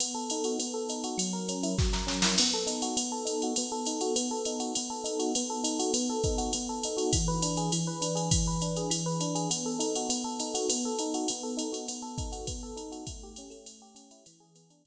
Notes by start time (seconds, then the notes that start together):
0.00 B3, ride
0.14 A4
0.30 D#4, hi-hat pedal, ride
0.44 F#4, ride
0.59 B3, ride
0.74 A4
0.89 D#4, hi-hat pedal, ride
1.04 F#4, ride
1.18 F#3, ride
1.33 A#4
1.48 C#4, hi-hat pedal, ride
1.63 E4, ride
1.78 F#3, kick, snare
1.93 A#4, snare
2.07 C#4, snare
2.22 E4, snare
2.38 B3, crash, ride
2.53 A4
2.67 D#4, hi-hat pedal, ride
2.82 F#4, ride
2.97 B3, ride
3.12 A4
3.25 D#4, hi-hat pedal, ride
3.42 F#4, ride
3.56 B3, ride
3.72 A4
3.85 D#4, hi-hat pedal, ride
4.01 F#4, ride
4.16 B3, ride
4.31 A4
4.45 D#4, hi-hat pedal, ride
4.60 F#4, ride
4.75 B3, ride
4.90 A4
5.04 D#4, hi-hat pedal, ride
5.19 F#4, ride
5.35 B3, ride
5.50 A4
5.64 D#4, hi-hat pedal, ride
5.79 F#4, ride
5.94 B3, ride
6.09 A4
6.23 D#4, kick, hi-hat pedal, ride
6.38 F#4, ride
6.53 B3, ride
6.69 A4
6.83 D#4, hi-hat pedal, ride
6.97 F#4, ride
7.13 E3, kick, ride
7.28 B4
7.42 D4, hi-hat pedal, ride
7.57 G#4, ride
7.72 E3, ride
7.87 B4
8.01 D4, hi-hat pedal, ride
8.15 G#4, ride
8.31 E3, kick, ride
8.47 B4
8.61 D4, hi-hat pedal, ride
8.76 G#4, ride
8.90 E3, ride
9.06 B4
9.20 D4, hi-hat pedal, ride
9.35 G#4, ride
9.50 B3, ride
9.66 A4
9.79 D#4, hi-hat pedal, ride
9.95 F#4, ride
10.09 B3, ride
10.24 A4
10.39 D#4, hi-hat pedal, ride
10.54 F#4, ride
10.69 B3, ride
10.85 A4
10.99 D#4, hi-hat pedal, ride
11.14 F#4, ride
11.28 B3, ride
11.43 A4
11.57 D#4, hi-hat pedal, ride
11.72 F#4, ride
11.88 B3, ride
12.02 A4
12.18 D#4, kick, hi-hat pedal, ride
12.32 F#4, ride
12.47 B3, kick, ride
12.63 A4
12.76 D#4, hi-hat pedal, ride
12.92 F#4, ride
13.07 A3, kick, ride
13.23 G4
13.36 C#4, hi-hat pedal, ride
13.50 A3, ride
13.66 ride
13.82 G4
13.95 C#4, hi-hat pedal, ride
14.11 E4, ride
14.26 E3, ride
14.40 G#4
14.55 B3, hi-hat pedal, ride
14.70 D4, ride
14.85 E3, kick, ride